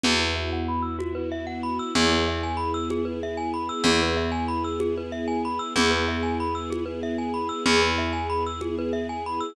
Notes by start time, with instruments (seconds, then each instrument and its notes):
0.03 electric bass (finger) E2, string ensemble 1 B3 E4 F#4, glockenspiel F#4, low conga
0.20 glockenspiel B4
0.36 glockenspiel E5
0.53 glockenspiel F#5
0.68 glockenspiel B5
0.82 glockenspiel E6
0.99 glockenspiel F#4, high conga
1.15 glockenspiel B4
1.32 glockenspiel E5
1.47 glockenspiel F#5
1.63 glockenspiel B5
1.79 glockenspiel E6
1.95 electric bass (finger) E2, string ensemble 1 B3 E4 G#4, glockenspiel G#4, low conga
2.11 glockenspiel B4
2.28 glockenspiel E5
2.43 glockenspiel G#5
2.57 glockenspiel B5
2.74 glockenspiel E6
2.90 glockenspiel G#4, high conga
3.05 glockenspiel B4
3.23 glockenspiel E5
3.37 glockenspiel G#5
3.54 glockenspiel B5
3.69 glockenspiel E6
3.84 electric bass (finger) E2, string ensemble 1 B3 E4 G#4, glockenspiel G#4, low conga
4.02 glockenspiel B4
4.17 glockenspiel E5
4.32 glockenspiel G#5
4.48 glockenspiel B5
4.64 glockenspiel E6
4.80 glockenspiel G#4, high conga
4.97 glockenspiel B4
5.12 glockenspiel E5
5.28 glockenspiel G#5
5.45 glockenspiel B5
5.59 glockenspiel E6
5.76 electric bass (finger) E2, string ensemble 1 B3 E4 G#4, glockenspiel G#4, low conga
5.91 glockenspiel B4
6.08 glockenspiel E5
6.23 glockenspiel G#5
6.40 glockenspiel B5
6.55 glockenspiel E6
6.70 glockenspiel G#4, high conga
6.86 glockenspiel B4
7.03 glockenspiel E5
7.18 glockenspiel G#5
7.34 glockenspiel B5
7.49 glockenspiel E6
7.66 electric bass (finger) E2, string ensemble 1 B3 E4 G#4, glockenspiel G#4, low conga
7.82 glockenspiel B4
7.98 glockenspiel E5
8.13 glockenspiel G#5
8.30 glockenspiel B5
8.46 glockenspiel E6
8.61 glockenspiel G#4, high conga
8.79 glockenspiel B4
8.93 glockenspiel E5
9.09 glockenspiel G#5
9.26 glockenspiel B5
9.40 glockenspiel E6